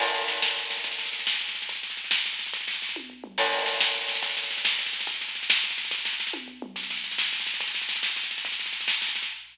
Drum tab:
CC |x-----------|------------|------------|------------|
SD |oooooooooooo|oooooooooooo|oooooooooooo|oooooo------|
T1 |------------|------------|------------|------o-----|
T2 |------------|------------|------------|----------o-|
FT |------------|------------|------------|--------o---|
BD |o-----------|o-----------|o-----------|o-----o-----|

CC |x-----------|------------|------------|------------|
SD |oooooooooooo|oooooooooooo|oooooooooooo|oooooo------|
T1 |------------|------------|------------|------o-----|
T2 |------------|------------|------------|----------o-|
FT |------------|------------|------------|--------o---|
BD |o-----------|o-----------|o-----------|o-----o-----|

CC |------------|------------|------------|
SD |oooooooooooo|oooooooooooo|oooooooooooo|
T1 |------------|------------|------------|
T2 |------------|------------|------------|
FT |------------|------------|------------|
BD |o-----------|o-----------|o-----------|